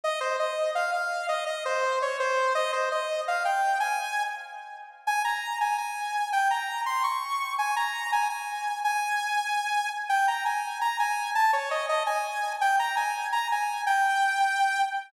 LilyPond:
\new Staff { \time 7/8 \key aes \major \tempo 4 = 167 ees''8 c''8 ees''4 f''8 f''4 | ees''8 ees''8 c''4 des''8 c''4 | ees''8 c''8 ees''4 f''8 g''4 | aes''4. r2 |
aes''8 bes''4 aes''8 aes''4. | g''8 bes''4 c'''8 des'''4. | aes''8 bes''4 aes''8 aes''4. | aes''2. r8 |
g''8 bes''8 aes''4 bes''8 aes''4 | a''8 des''8 ees''8 ees''8 aes''4. | g''8 bes''8 aes''4 bes''8 aes''4 | g''2. r8 | }